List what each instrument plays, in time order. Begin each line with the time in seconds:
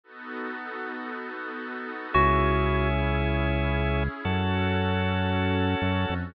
0.04 pad 5 (bowed) B3 D#4 F#4 A4
2.14 synth bass 1 C#2, drawbar organ C#4 E4 G#4, pad 5 (bowed) C#4 E4 G#4, electric piano 2 F#4
4.25 synth bass 1 F#2, drawbar organ C#4 F#4 A4, pad 5 (bowed) C#4 F#4 A4
5.82 synth bass 1 F#2
6.10 synth bass 1 F2